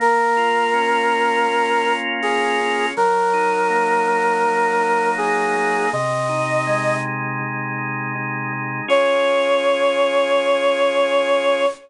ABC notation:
X:1
M:4/4
L:1/8
Q:1/4=81
K:Db
V:1 name="Brass Section"
B6 A2 | B6 A2 | e3 z5 | d8 |]
V:2 name="Drawbar Organ"
B, F D F B, F F D | G, E B, E G, E E B, | C, E A, E C, E E A, | [DFA]8 |]